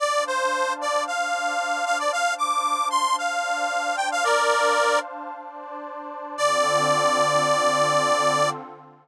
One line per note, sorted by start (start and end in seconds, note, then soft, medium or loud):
0.00 1.05 D4 medium
0.00 1.05 C5 medium
0.00 0.24 D5 medium
0.00 1.06 F5 medium
0.00 1.05 A5 medium
0.27 0.73 C5 medium
0.81 1.04 D5 medium
1.06 2.11 D4 medium
1.06 2.11 C5 medium
1.06 2.11 D5 medium
1.06 1.85 F5 medium
1.06 2.11 A5 medium
1.86 1.98 F5 medium
1.99 2.12 D5 medium
2.12 3.17 D4 medium
2.12 3.17 C5 medium
2.12 3.17 F5 medium
2.12 2.34 F5 medium
2.12 3.17 A5 medium
2.38 2.88 D6 medium
2.90 3.16 C6 medium
3.18 4.25 D4 medium
3.18 4.25 C5 medium
3.18 4.25 D5 medium
3.18 3.96 F5 medium
3.18 4.25 A5 medium
3.97 4.09 G5 medium
4.12 4.24 F5 medium
4.24 5.30 D4 medium
4.24 4.99 A#4 medium
4.24 5.30 C5 medium
4.24 4.99 D5 medium
4.24 5.31 F5 medium
4.24 5.30 A5 medium
5.31 6.36 D4 medium
5.31 6.36 C5 medium
5.31 6.36 D5 medium
5.31 6.36 A5 medium
6.36 8.48 D3 loud
6.36 8.48 C4 loud
6.36 8.48 F4 loud
6.36 8.48 A4 medium
6.36 8.50 D5 loud